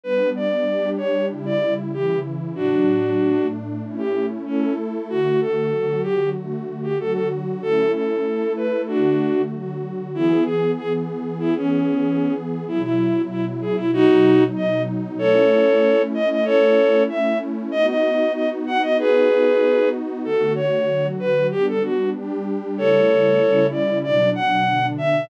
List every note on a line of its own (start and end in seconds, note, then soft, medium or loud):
0.04 0.66 G3 medium
0.04 0.66 B3 medium
0.04 0.66 D4 medium
0.04 0.30 B4 medium
0.36 0.90 D5 medium
0.67 1.29 G3 medium
0.67 1.29 D4 medium
0.67 1.29 G4 medium
0.97 1.26 C#5 medium
1.30 1.92 C#3 medium
1.30 1.92 G3 medium
1.30 1.92 E4 medium
1.46 1.74 D5 medium
1.93 2.56 C#3 medium
1.93 2.56 E3 medium
1.93 2.56 E4 medium
1.93 2.19 G4 medium
2.55 3.19 A2 medium
2.55 3.19 F#3 medium
2.55 3.47 D4 medium
2.55 3.19 D4 medium
2.55 3.47 F#4 medium
3.19 3.82 A2 medium
3.19 3.82 A3 medium
3.19 3.82 D4 medium
3.83 4.45 A3 medium
3.83 4.45 C#4 medium
3.83 4.45 E4 medium
3.98 4.26 G4 medium
4.46 5.08 A3 medium
4.46 4.73 C#4 medium
4.46 5.08 E4 medium
4.46 5.08 A4 medium
5.09 5.71 D3 medium
5.09 5.71 A3 medium
5.09 5.71 F#4 medium
5.09 5.40 F#4 medium
5.41 6.01 A4 medium
5.72 6.34 D3 medium
5.72 6.34 F#3 medium
5.72 6.34 F#4 medium
6.03 6.29 G4 medium
6.35 6.98 D3 medium
6.35 6.98 A3 medium
6.35 6.98 F#4 medium
6.83 6.98 G4 medium
6.98 7.61 D3 medium
6.98 7.61 F#3 medium
6.98 7.61 F#4 medium
6.98 7.13 A4 medium
7.13 7.28 A4 medium
7.61 8.24 A3 medium
7.61 8.24 C#4 medium
7.61 8.24 E4 medium
7.61 7.92 A4 medium
7.93 8.53 A4 medium
8.25 8.87 A3 medium
8.25 8.87 E4 medium
8.25 8.87 A4 medium
8.56 8.82 B4 medium
8.87 9.50 D3 medium
8.87 9.50 A3 medium
8.87 9.42 D4 medium
8.87 9.42 F#4 medium
8.87 9.50 F#4 medium
9.51 10.13 D3 medium
9.51 10.13 F#3 medium
9.51 10.13 F#4 medium
10.14 12.64 E3 medium
10.14 12.64 B3 medium
10.14 10.44 E4 medium
10.14 12.64 G#4 medium
10.45 10.71 G#4 medium
10.78 10.93 G#4 medium
11.40 11.55 E4 medium
11.57 12.34 C#4 medium
12.67 13.92 B2 medium
12.67 13.92 F#3 medium
12.67 13.92 E4 medium
12.67 12.82 E4 medium
12.83 13.22 E4 medium
13.30 13.45 E4 medium
13.61 13.76 G#4 medium
13.76 13.91 E4 medium
13.93 15.18 B2 medium
13.93 15.18 F#3 medium
13.93 15.18 D#4 medium
13.93 14.44 D#4 medium
13.93 14.44 F#4 loud
14.56 14.82 D#5 medium
15.18 17.70 A3 medium
15.18 17.70 C#4 medium
15.18 17.70 E4 medium
15.18 16.02 A4 medium
15.18 16.02 C#5 medium
16.14 16.29 D#5 medium
16.30 16.45 D#5 medium
16.45 17.03 A4 medium
16.45 17.03 C#5 medium
17.09 17.38 E5 medium
17.71 20.22 B3 medium
17.71 20.22 D#4 medium
17.71 20.22 F#4 medium
17.71 17.86 D#5 medium
17.88 18.33 D#5 medium
18.34 18.49 D#5 medium
18.67 18.82 F#5 medium
18.82 18.97 D#5 medium
18.99 19.89 G#4 medium
18.99 19.89 B4 medium
20.24 20.87 D3 medium
20.24 20.87 A3 medium
20.24 20.87 F#4 medium
20.24 20.53 A4 medium
20.55 21.07 C#5 medium
20.88 21.50 D3 medium
20.88 21.50 F#3 medium
20.88 21.50 F#4 medium
21.20 21.47 B4 medium
21.51 22.13 G3 medium
21.51 22.13 B3 medium
21.51 22.13 D4 medium
21.51 21.66 G4 medium
21.68 21.83 A4 medium
21.83 22.10 F#4 medium
22.14 22.77 G3 medium
22.14 22.77 D4 medium
22.14 22.77 G4 medium
22.77 23.40 C#3 medium
22.77 23.40 G3 medium
22.77 23.40 A3 medium
22.77 23.40 E4 medium
22.77 23.67 A4 medium
22.77 23.67 C#5 medium
23.40 24.03 C#3 medium
23.40 24.03 G3 medium
23.40 24.03 C#4 medium
23.40 24.03 E4 medium
23.72 23.99 D5 medium
24.03 24.66 B2 medium
24.03 24.66 F#3 medium
24.03 24.66 D4 medium
24.03 24.30 D5 medium
24.35 24.86 F#5 medium
24.67 25.29 B2 medium
24.67 25.29 D3 medium
24.67 25.29 D4 medium
24.98 25.25 E5 medium